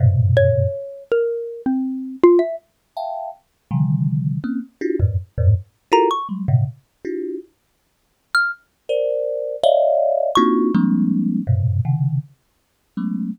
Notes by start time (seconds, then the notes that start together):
0.00 F#2 G2 A2 A#2 B2 C3
0.37 C#5
1.12 A#4
1.66 C4
2.23 F4
2.39 E5
2.96 E5 F5 G5 A5
3.71 C3 D3 D#3 F3 G3
4.44 A#3 C4 C#4
4.81 D4 E4 F4 F#4 G4
5.00 F2 F#2 G#2 A2
5.38 F2 G2 G#2 A2
5.92 E4 F4 F#4 G4 A4 A#4 A#5
6.11 C#6
6.29 F#3 G3 G#3
6.48 G#2 A#2 B2 C3 C#3
7.05 D4 E4 F4 F#4 G4
8.35 F6
8.89 A#4 C5 D5
9.63 C#5 D5 D#5 E5 F5
10.35 A#3 C4 D4 D#4 F4 F#4 C#6
10.75 F3 G3 G#3 A#3 C4 D4
11.47 F#2 G2 G#2 A#2 B2 C3
11.85 C3 C#3 D#3
12.97 F#3 G#3 A3 B3 C#4